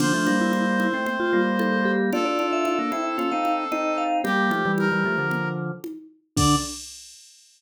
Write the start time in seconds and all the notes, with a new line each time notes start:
0.00 D3 F3 D4 C5, crash, low conga
0.13 F3 A3 D4
0.26 G3 A#3, high conga
0.41 E4
0.53 E4, high conga
0.80 E4, high conga
0.94 A3 C4
1.06 A3 C4, low conga
1.20 F4
1.33 G3 A#3
1.59 A4, high conga
1.85 G4
2.12 D4 F4 A4 D5, low conga
2.25 D4 F4 D5
2.39 D4 F4, high conga
2.53 E5
2.65 E5, high conga
2.79 A#3 D4
2.92 C4 E4 E5, high conga
3.18 C#4 F4, low conga
3.31 C4 D#4 F5
3.45 high conga
3.72 C4 D#4 D#5, high conga
3.98 F5
4.24 G3 A#3 G4, low conga
4.51 F3 A3, high conga
4.65 E3 G3
4.78 A#4, high conga
4.91 E3 G3
5.05 F3 A3
5.18 D3 F3
5.31 low conga
5.84 high conga
6.37 D3 D4 D5, kick, crash